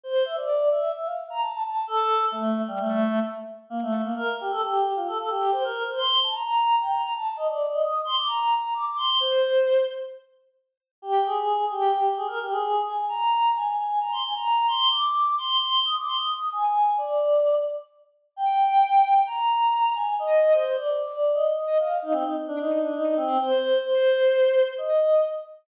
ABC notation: X:1
M:4/4
L:1/16
Q:1/4=131
K:F
V:1 name="Choir Aahs"
c2 e d3 e2 e f z b a a a2 | A4 A,3 G, A,4 z4 | [K:Bb] B, A,2 B, B2 G A G3 F A A G2 | c B2 c c'2 a b b3 g b b a2 |
e d2 e e'2 c' d' b3 b d' d' c'2 | c6 z10 | [K:Eb] G2 A4 G2 G2 A B G A3 | a2 b4 a2 a2 b c' a b3 |
c'2 d'4 c'2 c'2 e' d' c' e'3 | a4 d6 z6 | g8 b6 a2 | e3 c c d2 d3 e2 e2 f2 |
E C E z D E2 D E2 C2 c4 | c8 e4 z4 |]